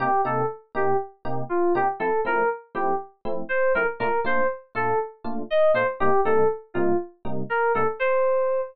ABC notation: X:1
M:4/4
L:1/16
Q:1/4=120
K:Cdor
V:1 name="Electric Piano 2"
G2 A2 z2 G2 z4 F2 G z | A2 B2 z2 G2 z4 c2 B z | B2 c2 z2 A2 z4 e2 c z | G2 A2 z2 F2 z4 B2 A z |
c6 z10 |]
V:2 name="Electric Piano 1"
[C,B,EG]2 [C,B,EG]4 [C,B,EG]4 [C,B,EG]4 [C,B,EG]2 | [F,A,C=E]2 [F,A,CE]4 [F,A,CE]4 [F,A,CE]4 [F,A,CE]2 | [B,,A,DF]2 [B,,A,DF]4 [B,,A,DF]4 [B,,A,DF]4 [B,,A,DF]2 | [C,G,B,E]2 [C,G,B,E]4 [C,G,B,E]4 [C,G,B,E]4 [C,G,B,E]2 |
z16 |]